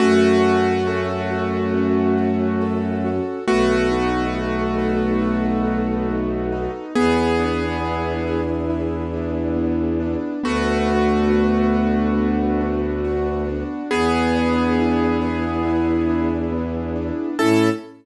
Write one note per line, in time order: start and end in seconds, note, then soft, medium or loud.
0.00 3.20 F#2 medium
0.00 3.11 A3 medium
0.00 1.73 C#4 loud
0.00 3.11 F#4 loud
0.44 1.30 F#4 medium
0.87 2.60 A4 medium
1.30 2.17 F#4 medium
1.74 3.39 C#4 medium
2.17 3.04 F#4 medium
2.61 3.43 A4 medium
3.04 3.46 F#4 medium
3.48 6.68 B1 medium
3.48 6.71 A3 medium
3.48 6.08 B3 loud
3.48 6.71 F#4 medium
3.91 5.65 D#4 medium
4.35 5.21 F#4 medium
4.78 6.85 A4 medium
5.22 6.87 F#4 medium
5.65 6.52 D#4 medium
6.09 6.91 B3 medium
6.52 6.93 D#4 medium
6.95 10.16 E2 medium
6.95 8.41 B3 medium
6.95 9.56 B3 medium
6.95 8.41 G#4 medium
7.39 9.12 D4 medium
7.83 8.69 E4 medium
8.26 10.33 G#4 medium
8.70 10.35 E4 medium
9.13 10.00 D4 medium
9.56 10.39 B3 medium
10.00 10.41 D4 medium
10.43 13.63 D2 medium
10.43 13.43 A3 medium
10.43 12.17 B3 loud
10.43 13.43 F#4 medium
10.87 11.73 D4 medium
11.30 13.04 F#4 medium
11.74 12.60 D4 medium
12.17 13.83 B3 medium
12.61 13.47 D4 medium
13.05 13.87 F#4 medium
13.48 13.89 D4 medium
13.91 17.11 E2 medium
13.91 16.29 B3 medium
13.91 16.51 B3 loud
13.91 16.29 G#4 medium
14.35 16.08 D4 medium
14.78 15.65 E4 medium
15.22 17.28 G#4 medium
15.65 17.30 E4 medium
16.09 16.95 D4 medium
16.52 17.35 B3 medium
16.96 17.37 D4 medium
17.39 17.70 A2 loud
17.39 17.70 C#4 loud
17.39 17.70 E4 loud
17.39 17.69 A4 loud
17.39 17.70 A4 loud